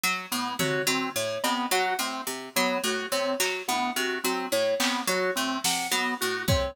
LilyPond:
<<
  \new Staff \with { instrumentName = "Harpsichord" } { \clef bass \time 6/8 \tempo 4. = 71 fis8 a,8 c8 fis8 a,8 c8 | fis8 a,8 c8 fis8 a,8 c8 | fis8 a,8 c8 fis8 a,8 c8 | fis8 a,8 c8 fis8 a,8 c8 | }
  \new Staff \with { instrumentName = "Drawbar Organ" } { \time 6/8 r8 b8 fis'8 c'8 r8 b8 | fis'8 c'8 r8 b8 fis'8 c'8 | r8 b8 fis'8 c'8 r8 b8 | fis'8 c'8 r8 b8 fis'8 c'8 | }
  \new Staff \with { instrumentName = "Electric Piano 2" } { \time 6/8 r4 cis''8 r8 cis''8 r8 | fis''8 r4 cis''8 r8 cis''8 | r8 fis''8 r4 cis''8 r8 | cis''8 r8 fis''8 r4 cis''8 | }
  \new DrumStaff \with { instrumentName = "Drums" } \drummode { \time 6/8 r4 tomfh8 cb4 cb8 | r8 cb4 r4. | hc8 tommh4 r4 hc8 | cb4 sn8 r4 bd8 | }
>>